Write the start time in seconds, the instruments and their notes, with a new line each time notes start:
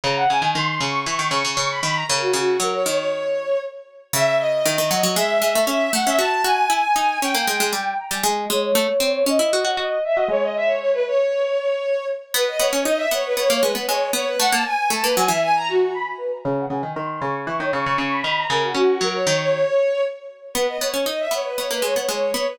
0.04 harpsichord C#3, violin A#5
0.16 violin F#5
0.29 harpsichord C#3, violin G#5
0.42 harpsichord D#3
0.55 harpsichord D#3, violin C6
0.67 violin C6
0.81 harpsichord C#3, violin C#6
1.06 harpsichord E3, violin C#6
1.19 harpsichord D#3, violin C#6
1.31 harpsichord C#3, violin C#6
1.45 harpsichord C#3
1.57 harpsichord C#3, violin C#6
1.70 violin B5
1.83 harpsichord D#3, violin B5
1.94 violin A#5
2.08 harpsichord C#3, violin A#4
2.20 violin F#4
2.33 harpsichord C#3, violin F#4
2.60 harpsichord F#3, violin A#4
2.73 violin C#5
2.86 harpsichord D#3, violin C#5
2.97 violin C#5
4.13 harpsichord C#3, violin E5
4.38 violin D#5
4.65 harpsichord D#3
4.78 harpsichord D#3
4.91 harpsichord F#3
5.03 harpsichord F#3
5.16 harpsichord G#3, violin E5
5.42 harpsichord G#3
5.55 harpsichord A3
5.67 harpsichord C#4, violin E5
5.93 harpsichord A3, violin F#5
6.05 harpsichord C#4, violin E5
6.19 harpsichord F#4, violin A5
6.44 harpsichord F#4, violin G#5
6.70 harpsichord E4
6.96 harpsichord D#4
7.22 harpsichord C#4, violin G5
7.35 harpsichord A#3
7.47 harpsichord G#3
7.60 harpsichord G#3
7.73 harpsichord G3, violin G5
7.99 violin A#5
8.11 harpsichord G3, violin G#5
8.24 harpsichord G#3, violin D#5
8.50 harpsichord G#3, violin C#5
8.75 harpsichord A3
9.00 harpsichord C4
9.25 harpsichord C#4, violin D#5
9.39 harpsichord E4
9.53 harpsichord F#4
9.65 harpsichord F#4
9.77 harpsichord F#4, violin D#5
10.04 violin E5
10.15 harpsichord F#4, violin D#5
10.28 harpsichord G#3, violin C#5
10.42 violin D#5
10.56 violin E5
10.67 violin C#5
10.79 violin C#5
10.93 violin B4
11.07 violin C#5
12.34 harpsichord B3, violin B4
12.48 violin D#5
12.59 harpsichord B3, violin C#5
12.73 harpsichord C#4
12.85 harpsichord D#4, violin D#5
12.97 violin E5
13.11 harpsichord B3, violin C#5
13.25 violin B4
13.37 harpsichord B3, violin C#5
13.49 harpsichord A#3, violin C#5
13.61 harpsichord G#3, violin B4
13.75 harpsichord B3
13.87 harpsichord G#3, violin C#5
14.13 harpsichord B3, violin C#5
14.27 violin B4
14.40 harpsichord A3, violin F#5
14.51 harpsichord A#3, violin A5
14.65 violin G#5
14.90 harpsichord A3, violin A5
15.02 harpsichord A#3, violin B4
15.16 harpsichord F#3, violin G#5
15.28 harpsichord E3, violin E5
15.43 violin G#5
15.56 violin A#5
15.69 violin F#4
15.94 violin B5
16.18 violin B4
16.31 violin A#5
16.43 harpsichord C#3, violin A#5
16.58 violin F#5
16.69 harpsichord C#3, violin G#5
16.83 harpsichord D#3
16.96 harpsichord D#3, violin C6
17.10 violin C6
17.20 harpsichord C#3, violin C#6
17.46 harpsichord E3, violin C#6
17.60 harpsichord D#3, violin C#5
17.73 harpsichord C#3, violin C#6
17.86 harpsichord C#3
17.98 harpsichord C#3, violin C#6
18.10 violin B5
18.24 harpsichord D#3, violin B5
18.37 violin A#5
18.50 harpsichord C#3, violin A#4
18.63 violin F#4
18.74 harpsichord C#4, violin F#4
19.01 harpsichord F#3, violin A#4
19.13 violin C#5
19.27 harpsichord D#3, violin C#5
19.40 violin C#5
20.54 harpsichord B3, violin B4
20.68 violin D#5
20.80 harpsichord B3, violin C#5
20.94 harpsichord C#4
21.06 harpsichord D#4, violin D#5
21.20 violin E5
21.31 harpsichord B3, violin C#5
21.45 violin B4
21.57 harpsichord B3, violin C#5
21.71 harpsichord A#3, violin B4
21.82 harpsichord G#3, violin C#5
21.96 harpsichord B3
22.09 harpsichord G#3, violin C#5
22.34 harpsichord B3, violin C#5
22.48 violin B4